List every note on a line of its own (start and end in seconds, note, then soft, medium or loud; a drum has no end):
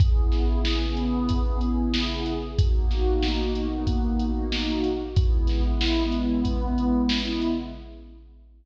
0.00 2.32 C#3 medium
0.00 2.32 B3 medium
0.00 2.32 E4 medium
0.00 2.32 G#4 medium
0.00 kick loud
0.00 closed hi-hat medium
0.32 snare medium
0.32 closed hi-hat medium
0.65 snare medium
0.97 closed hi-hat medium
1.29 kick medium
1.29 closed hi-hat medium
1.61 closed hi-hat medium
1.94 snare loud
2.26 closed hi-hat medium
2.58 4.90 B2 medium
2.58 4.90 A#3 medium
2.58 4.90 D#4 medium
2.58 4.90 F#4 medium
2.58 kick loud
2.58 closed hi-hat loud
2.91 snare medium
2.91 closed hi-hat medium
3.22 snare medium
3.55 closed hi-hat medium
3.87 kick medium
3.87 closed hi-hat medium
4.19 closed hi-hat medium
4.52 snare medium
4.84 closed hi-hat medium
5.16 7.49 C#3 medium
5.16 7.49 G#3 medium
5.16 7.49 B3 medium
5.16 7.49 E4 medium
5.16 kick loud
5.16 closed hi-hat medium
5.47 snare medium
5.47 closed hi-hat medium
5.81 snare loud
6.12 closed hi-hat medium
6.45 kick medium
6.45 closed hi-hat medium
6.78 closed hi-hat medium
7.09 snare loud
7.41 closed hi-hat medium